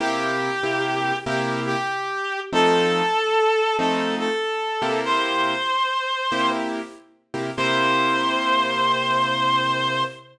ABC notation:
X:1
M:4/4
L:1/8
Q:"Swing" 1/4=95
K:C
V:1 name="Clarinet"
G4 G G3 | A4 A A3 | c5 z3 | c8 |]
V:2 name="Acoustic Grand Piano"
[C,_B,EG]2 [C,B,EG]2 [C,B,EG]4 | [F,A,C_E]4 [F,A,CE]3 [C,_B,=EG]- | [C,_B,EG]4 [C,B,EG]3 [C,B,EG] | [C,_B,EG]8 |]